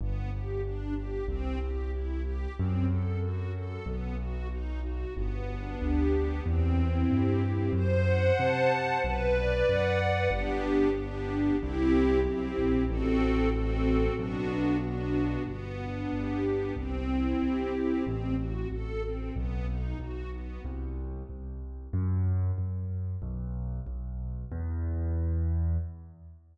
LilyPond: <<
  \new Staff \with { instrumentName = "String Ensemble 1" } { \time 2/4 \key e \minor \tempo 4 = 93 b8 g'8 d'8 g'8 | c'8 g'8 e'8 g'8 | c'8 a'8 fis'8 a'8 | b8 fis'8 dis'8 fis'8 |
b8 d'8 g'8 b8 | c'8 e'8 g'8 c'8 | c''8 fis''8 a''8 c''8 | b'8 d''8 fis''8 b'8 |
<b d' g'>4 <b d' g'>4 | <c' e' g'>4 <c' e' g'>4 | <c' fis' a'>4 <c' fis' a'>4 | <b d' fis'>4 <b d' fis'>4 |
b8 d'8 g'8 b8 | c'8 e'8 g'8 c'8 | c'8 fis'8 a'8 c'8 | b8 dis'8 fis'8 b8 |
r2 | r2 | r2 | r2 | }
  \new Staff \with { instrumentName = "Acoustic Grand Piano" } { \clef bass \time 2/4 \key e \minor g,,2 | c,2 | fis,2 | b,,2 |
g,,4 d,4 | e,4 g,4 | fis,4 c4 | b,,4 fis,4 |
g,,2 | c,4 b,,8 ais,,8 | a,,2 | b,,2 |
g,,4 g,,4 | c,4 c,4 | a,,4 a,,4 | b,,4 b,,4 |
c,4 c,4 | fis,4 fis,4 | b,,4 b,,4 | e,2 | }
>>